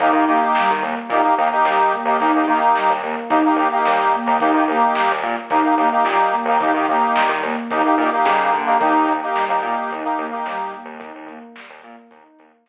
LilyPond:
<<
  \new Staff \with { instrumentName = "Ocarina" } { \time 4/4 \key ees \mixolydian \tempo 4 = 109 ees'8 bes8 g8 bes8 ees'8 bes8 g8 bes8 | ees'8 bes8 g8 bes8 ees'8 bes8 g8 bes8 | ees'8 bes8 g8 bes8 ees'8 bes8 g8 bes8 | ees'8 bes8 g8 bes8 ees'8 bes8 g8 bes8 |
ees'8 bes8 g8 bes8 ees'8 bes8 g8 bes8 | ees'8 bes8 g8 bes8 ees'8 bes8 g8 r8 | }
  \new Staff \with { instrumentName = "Accordion" } { \time 4/4 \key ees \mixolydian <bes ees' g'>16 <bes ees' g'>16 <bes ees' g'>4. <bes ees' g'>16 <bes ees' g'>16 <bes ees' g'>16 <bes ees' g'>4 <bes ees' g'>16 | <bes ees' g'>16 <bes ees' g'>16 <bes ees' g'>4. <bes ees' g'>16 <bes ees' g'>16 <bes ees' g'>16 <bes ees' g'>4 <bes ees' g'>16 | <bes ees' g'>16 <bes ees' g'>16 <bes ees' g'>4. <bes ees' g'>16 <bes ees' g'>16 <bes ees' g'>16 <bes ees' g'>4 <bes ees' g'>16 | <bes ees' g'>16 <bes ees' g'>16 <bes ees' g'>4. <bes ees' g'>16 <bes ees' g'>16 <bes ees' g'>16 <bes ees' g'>4 <bes ees' g'>16 |
<bes ees' g'>8. <bes ees' g'>8 <bes ees' g'>4 <bes ees' g'>8 <bes ees' g'>4~ <bes ees' g'>16 | r1 | }
  \new Staff \with { instrumentName = "Synth Bass 1" } { \clef bass \time 4/4 \key ees \mixolydian ees,16 ees16 ees8. ees16 ees,8 bes,8 ees,8 ees,8. ees,16 | ees,16 ees,16 ees8. ees,16 ees,8 ees,8 ees,8 ees,8. ees,16 | ees,16 ees16 ees,8. ees,16 bes,8 ees,8 ees,8 bes,8. ees,16 | ees,16 ees16 ees,8. ees16 ees,8 ees,8 bes,8 des8 d8 |
ees,16 ees,16 ees,8. ees,16 bes,8 ees,8 ees,8 ees,8. ees,16 | ees,16 ees,16 ees,8. ees,16 bes,8 ees,8 ees,8 ees,8. r16 | }
  \new DrumStaff \with { instrumentName = "Drums" } \drummode { \time 4/4 <hh bd>8 hh8 sn8 hh8 <hh bd>8 hh8 sn8 <hh bd>8 | <hh bd>8 <hh bd>8 sn8 hh8 <hh bd>8 hh8 sn8 <hh bd>8 | <hh bd>8 hh8 sn8 hh8 <hh bd>8 <hh sn>8 sn8 hh8 | <hh bd>8 <hh bd>8 sn8 hh8 <hh bd>8 <hh sn>8 sn8 <hh bd>8 |
<hh bd>8 hh8 sn8 hh8 <hh bd>8 hh8 sn8 <hh bd>8 | <hh bd>8 <hh bd>8 sn8 hh8 <hh bd>8 hh8 sn4 | }
>>